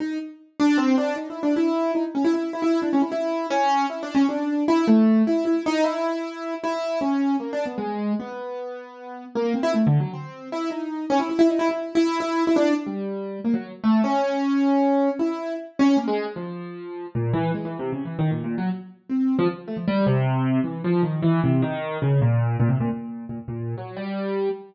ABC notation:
X:1
M:3/4
L:1/16
Q:1/4=154
K:none
V:1 name="Acoustic Grand Piano"
_E2 z4 D2 C2 D2 | (3_E2 =E2 D2 E4 _E z _D =E | E2 E E2 D _D E E4 | _D4 (3E2 =D2 _D2 =D4 |
E2 A,4 E2 E2 _E2 | E8 E4 | _D4 (3_B,2 =D2 =B,2 _A,4 | B,12 |
_B,2 C E (3A,2 D,2 _G,2 C4 | E2 _E4 _D =E E E _E =E | (3E4 E4 E4 E D2 z | G,6 _B, _G,2 z A,2 |
_D12 | E4 z2 _D2 _B, _A,2 z | F,8 _B,,2 E,2 | (3_A,2 E,2 C,2 (3_D,2 E,2 _E,2 (3_B,,2 B,,2 _G,2 |
z4 C3 F, z2 A, F, | G,2 C,6 E,2 F,2 | _E,2 =E,2 C,2 _E,4 _D,2 | _B,,4 B,, C, B,, B,,4 B,, |
z _B,,3 _G,2 =G,6 |]